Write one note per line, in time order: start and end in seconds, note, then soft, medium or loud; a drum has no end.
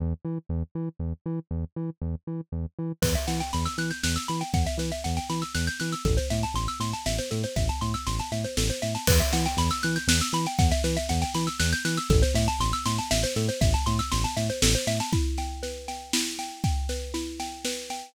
0.00 0.14 E2 medium
0.25 0.38 E3 medium
0.49 0.63 E2 medium
0.75 0.89 E3 medium
0.99 1.13 E2 medium
1.26 1.39 E3 medium
1.51 1.65 E2 medium
1.76 1.90 E3 medium
2.01 2.15 E2 medium
2.27 2.41 E3 medium
2.52 2.66 E2 medium
2.79 2.92 E3 medium
3.02 3.16 E2 medium
3.02 3.13 B4 loud
3.02 kick medium
3.02 snare medium
3.02 crash loud
3.15 3.26 E5 medium
3.15 snare medium
3.27 3.42 E3 medium
3.27 3.39 F#5 medium
3.27 snare medium
3.40 3.52 G5 medium
3.40 snare medium
3.53 3.68 E2 medium
3.53 3.64 B5 medium
3.53 snare medium
3.65 3.77 E6 medium
3.65 snare medium
3.78 3.92 E3 medium
3.78 3.90 F#6 medium
3.78 snare medium
3.91 4.02 G6 medium
3.91 snare medium
4.03 4.18 E2 medium
4.03 4.15 F#6 medium
4.03 snare loud
4.16 4.27 E6 medium
4.16 snare medium
4.28 4.43 E3 medium
4.28 4.40 B5 medium
4.28 snare medium
4.41 4.52 G5 medium
4.41 snare medium
4.53 4.67 E2 medium
4.53 4.65 F#5 medium
4.53 kick medium
4.53 snare medium
4.66 4.78 E5 medium
4.66 snare medium
4.78 4.91 E3 medium
4.78 4.90 B4 medium
4.78 snare medium
4.92 5.03 E5 medium
4.92 snare medium
5.04 5.19 E2 medium
5.04 5.16 F#5 medium
5.04 snare medium
5.17 5.28 G5 medium
5.17 snare medium
5.30 5.43 E3 medium
5.30 5.41 B5 medium
5.30 snare medium
5.42 5.53 E6 medium
5.42 snare medium
5.55 5.69 E2 medium
5.55 5.66 F#6 medium
5.55 snare medium
5.67 5.79 G6 medium
5.67 snare medium
5.80 5.95 E3 medium
5.80 5.91 F#6 medium
5.80 snare medium
5.92 6.04 E6 medium
5.92 snare medium
6.05 6.19 A1 medium
6.05 6.16 A4 loud
6.05 kick medium
6.05 snare medium
6.17 6.29 C5 medium
6.17 snare medium
6.30 6.45 A2 medium
6.30 6.42 E5 medium
6.30 snare medium
6.43 6.55 A5 medium
6.43 snare medium
6.54 6.68 A1 medium
6.54 6.67 C6 loud
6.54 snare medium
6.68 6.79 E6 medium
6.68 snare medium
6.80 6.94 A2 medium
6.80 6.92 C6 medium
6.80 snare medium
6.93 7.05 A5 medium
6.93 snare medium
7.06 7.20 A1 medium
7.06 7.17 E5 medium
7.06 snare medium
7.18 7.30 C5 medium
7.18 snare medium
7.31 7.45 A2 medium
7.31 7.42 A4 medium
7.31 snare medium
7.43 7.55 C5 medium
7.43 snare medium
7.56 7.70 A1 medium
7.56 7.68 E5 medium
7.56 kick medium
7.56 snare medium
7.69 7.80 A5 medium
7.69 snare medium
7.81 7.95 A2 medium
7.81 7.93 C6 medium
7.81 snare medium
7.94 8.05 E6 medium
7.94 snare medium
8.07 8.21 A1 medium
8.07 8.18 C6 medium
8.07 snare medium
8.19 8.31 A5 medium
8.19 snare medium
8.32 8.46 A2 medium
8.32 8.43 E5 medium
8.32 snare medium
8.44 8.56 C5 medium
8.44 snare medium
8.57 8.71 A1 medium
8.57 8.69 A4 medium
8.57 snare loud
8.70 8.81 C5 medium
8.70 snare medium
8.82 8.97 A2 medium
8.82 8.93 E5 medium
8.82 snare medium
8.95 9.06 A5 medium
8.95 snare medium
9.07 9.22 E2 medium
9.07 9.19 B4 loud
9.07 kick loud
9.07 snare medium
9.07 crash loud
9.20 9.31 E5 medium
9.20 snare medium
9.33 9.47 E3 medium
9.33 9.44 F#5 medium
9.33 snare medium
9.45 9.57 G5 loud
9.45 snare medium
9.57 9.71 E2 medium
9.57 9.70 B5 loud
9.57 snare medium
9.70 9.82 E6 loud
9.70 snare medium
9.83 9.98 E3 medium
9.83 9.95 F#6 loud
9.83 snare medium
9.96 10.07 G6 medium
9.96 snare medium
10.07 10.21 E2 medium
10.07 10.20 F#6 loud
10.07 snare loud
10.21 10.33 E6 medium
10.21 snare medium
10.33 10.47 E3 medium
10.33 10.45 B5 loud
10.33 snare medium
10.46 10.58 G5 medium
10.46 snare medium
10.58 10.72 E2 medium
10.58 10.70 F#5 loud
10.58 kick loud
10.58 snare medium
10.71 10.83 E5 loud
10.71 snare medium
10.84 10.98 E3 medium
10.84 10.95 B4 medium
10.84 snare medium
10.97 11.08 E5 loud
10.97 snare medium
11.09 11.24 E2 medium
11.09 11.21 F#5 medium
11.09 snare medium
11.22 11.33 G5 loud
11.22 snare medium
11.34 11.49 E3 medium
11.34 11.46 B5 medium
11.34 snare medium
11.47 11.58 E6 medium
11.47 snare medium
11.60 11.74 E2 medium
11.60 11.71 F#6 loud
11.60 snare loud
11.72 11.84 G6 loud
11.72 snare medium
11.85 11.99 E3 medium
11.85 11.96 F#6 medium
11.85 snare medium
11.97 12.09 E6 medium
11.97 snare medium
12.10 12.23 A1 medium
12.10 12.21 A4 loud
12.10 kick loud
12.10 snare medium
12.22 12.34 C5 loud
12.22 snare medium
12.34 12.48 A2 medium
12.34 12.47 E5 loud
12.34 snare medium
12.48 12.59 A5 loud
12.48 snare medium
12.59 12.73 A1 medium
12.59 12.72 C6 loud
12.59 snare medium
12.73 12.84 E6 loud
12.73 snare medium
12.86 13.00 A2 medium
12.86 12.97 C6 loud
12.86 snare medium
12.98 13.10 A5 medium
12.98 snare medium
13.11 13.25 A1 medium
13.11 13.22 E5 loud
13.11 snare loud
13.23 13.35 C5 loud
13.23 snare medium
13.36 13.50 A2 medium
13.36 13.48 A4 medium
13.36 snare medium
13.49 13.60 C5 medium
13.49 snare medium
13.61 13.75 A1 medium
13.61 13.72 E5 loud
13.61 kick loud
13.61 snare medium
13.74 13.85 A5 loud
13.74 snare medium
13.86 14.01 A2 medium
13.86 13.98 C6 loud
13.86 snare medium
13.99 14.10 E6 loud
13.99 snare medium
14.12 14.26 A1 medium
14.12 14.23 C6 loud
14.12 snare medium
14.24 14.36 A5 loud
14.24 snare medium
14.37 14.51 A2 medium
14.37 14.48 E5 medium
14.37 snare medium
14.50 14.61 C5 medium
14.50 snare medium
14.62 14.76 A1 medium
14.62 14.74 A4 medium
14.62 snare loud
14.75 14.86 C5 medium
14.75 snare medium
14.87 15.01 A2 medium
14.87 14.99 E5 loud
14.87 snare medium
15.00 15.12 A5 medium
15.00 snare medium
15.13 16.13 E4 loud
15.13 kick loud
15.13 snare medium
15.38 15.88 G5 medium
15.38 snare medium
15.63 16.89 B4 medium
15.63 snare medium
15.88 16.38 G5 medium
15.88 snare medium
16.13 17.13 E4 medium
16.13 snare loud
16.39 16.64 G5 medium
16.39 snare medium
16.64 17.39 G5 medium
16.64 kick medium
16.64 snare medium
16.89 17.65 B4 medium
16.89 snare medium
17.14 18.10 E4 loud
17.14 snare medium
17.40 17.90 G5 medium
17.40 snare medium
17.65 18.13 B4 medium
17.65 snare medium
17.90 18.14 G5 medium
17.90 snare medium